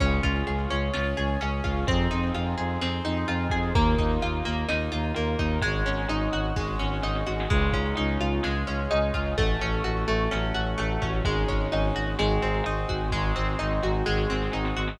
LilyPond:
<<
  \new Staff \with { instrumentName = "Orchestral Harp" } { \time 4/4 \key des \lydian \tempo 4 = 128 des'8 f'8 aes'8 des'8 f'8 aes'8 des'8 f'8 | c'8 ees'8 f'8 aes'8 c'8 ees'8 f'8 aes'8 | bes8 ees'8 f'8 bes8 ees'8 f'8 bes8 ees'8 | aes8 des'8 ees'8 ges'8 aes8 des'8 ees'8 ges'8 |
aes8 des'8 ees'8 f'8 aes8 des'8 ees'8 f'8 | a8 des'8 ges'8 a8 des'8 ges'8 a8 des'8 | aes8 des'8 ees'8 ges'8 aes8 c'8 ees'8 ges'8 | aes8 c'8 ees'8 ges'8 aes8 c'8 ees'8 ges'8 | }
  \new Staff \with { instrumentName = "Violin" } { \clef bass \time 4/4 \key des \lydian des,8 des,8 des,8 des,8 des,8 des,8 des,8 des,8 | f,8 f,8 f,8 f,8 f,8 f,8 f,8 f,8 | ees,8 ees,8 ees,8 ees,8 ees,8 ees,8 ees,8 ees,8 | aes,,8 aes,,8 aes,,8 aes,,8 aes,,8 aes,,8 aes,,8 aes,,8 |
des,8 des,8 des,8 des,8 des,8 des,8 des,8 des,8 | a,,8 a,,8 a,,8 a,,8 a,,8 a,,8 a,,8 a,,8 | aes,,8 aes,,8 aes,,8 aes,,8 aes,,8 aes,,8 aes,,8 aes,,8 | aes,,8 aes,,8 aes,,8 aes,,8 aes,,8 aes,,8 aes,,8 aes,,8 | }
  \new Staff \with { instrumentName = "Brass Section" } { \time 4/4 \key des \lydian <des' f' aes'>2 <des' aes' des''>2 | <c' ees' f' aes'>2 <c' ees' aes' c''>2 | <bes ees' f'>2 <bes f' bes'>2 | <aes des' ees' ges'>2 <aes des' ges' aes'>2 |
<aes des' ees' f'>2 <aes des' f' aes'>2 | <a des' ges'>2 <ges a ges'>2 | <aes des' ees' ges'>4 <aes des' ges' aes'>4 <aes c' ees' ges'>4 <aes c' ges' aes'>4 | <aes c' ees' ges'>2 <aes c' ges' aes'>2 | }
  \new DrumStaff \with { instrumentName = "Drums" } \drummode { \time 4/4 <cymc bd>8 <hh bd>8 hh8 hh8 sn8 hh8 hh8 <hh bd>8 | <hh bd>8 hh8 hh8 hh8 sn8 hh8 hh8 <hh bd>8 | <hh bd>8 <hh bd>8 hh8 hh8 sn8 hh8 hh8 <hh bd>8 | <hh bd>8 hh8 hh8 hh8 <bd sn>8 sn8 sn16 sn16 sn16 sn16 |
<cymc bd>8 <hh bd>8 hh8 hh8 sn8 hh8 hh8 <hh bd>8 | <hh bd>8 hh8 hh8 hh8 sn8 hh8 hh8 <hh bd>8 | <hh bd>8 <hh bd>8 hh8 hh8 sn8 hh8 hh8 <hh bd>8 | <bd sn>8 sn8 sn8 sn8 sn16 sn16 sn16 sn16 sn16 sn16 sn16 sn16 | }
>>